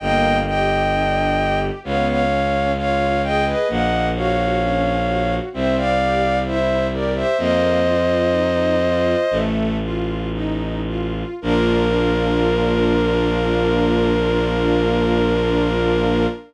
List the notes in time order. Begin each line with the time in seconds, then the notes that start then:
0.00 G1 A#3 D#5 G5
0.46 G4 D#5 G5
0.93 D4
1.38 G4
1.83 C#2 B3 C#5 F5
2.08 C#5 F5
2.32 C#4
2.76 F4 C#5 F5
3.23 G#4 D#5 G5
3.46 B4 D#5
3.68 A#1 A#3 D#5 F#5
4.15 F#4 C#5 F5
4.61 C#4
5.07 F#4
5.53 C2 C4 C5 E5
5.77 D5 F5
6.01 G4
6.46 E4 C5 E5
6.92 G4 A#4 D5
7.15 C5 E5
7.38 F2 A#3 C5 D#5
7.84 F4
8.31 D#4
8.81 F4
9.31 A1 A3
9.82 F4
10.33 D#4
10.86 F4
11.42 A#1 A#3 D4 F4 A#4